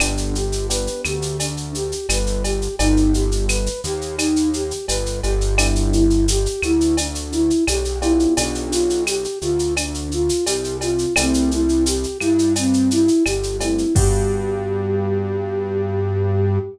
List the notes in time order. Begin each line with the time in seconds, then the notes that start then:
0.00 G1 B3 D4 G4, cowbell, claves, shaker
0.17 shaker
0.35 G4, shaker
0.52 shaker
0.69 B3 D4 G4 B4, shaker
0.87 shaker
1.05 D2 G4, claves, shaker
1.22 shaker
1.40 D4, cowbell, shaker
1.57 shaker
1.75 G4, shaker
1.92 shaker
2.09 G1 B4, cowbell, claves, shaker
2.26 shaker
2.43 G4, cowbell, shaker
2.62 shaker
2.79 G1 B3 D#4 G4, cowbell, shaker
2.97 shaker
3.13 G4, shaker
3.32 shaker
3.49 B4, claves, shaker
3.66 shaker
3.84 D#2 G4, shaker
4.01 shaker
4.18 D#4, cowbell, claves, shaker
4.36 shaker
4.53 G4, shaker
4.71 shaker
4.87 G1 B4, cowbell, shaker
5.06 shaker
5.23 G1 G4, cowbell, shaker
5.41 shaker
5.58 B3 D4 E4 G4, cowbell, claves, shaker
5.75 shaker
5.93 E4, shaker
6.10 shaker
6.28 G4, shaker
6.46 shaker
6.62 D2 E4, claves, shaker
6.81 shaker
6.97 D4, cowbell, shaker
7.15 shaker
7.32 E4, shaker
7.50 shaker
7.67 B1 G4, cowbell, claves, shaker
7.85 shaker
8.02 B3 D4 E4 F4 G4, cowbell, shaker
8.19 shaker
8.37 B1 D4, cowbell, shaker
8.55 shaker
8.71 F4, shaker
8.90 shaker
9.07 G4, claves, shaker
9.24 shaker
9.41 D2 F4, shaker
9.59 shaker
9.77 D4, cowbell, claves, shaker
9.94 shaker
10.11 F4, shaker
10.29 shaker
10.45 C2 G4, cowbell, shaker
10.64 shaker
10.81 F4, cowbell, shaker
10.98 shaker
11.16 C2 A3 C4 E4 G4, cowbell, claves, shaker
11.34 shaker
11.51 E4, shaker
11.69 shaker
11.86 G4, shaker
12.03 shaker
12.20 G2 E4, claves, shaker
12.39 shaker
12.56 C4, cowbell, shaker
12.74 shaker
12.91 E4, shaker
13.08 shaker
13.25 G1 G4, cowbell, claves, shaker
13.43 shaker
13.60 A3 C4 E4 G4, cowbell, shaker
13.78 shaker
13.95 G2 B3 D4 F#4 G4, kick, crash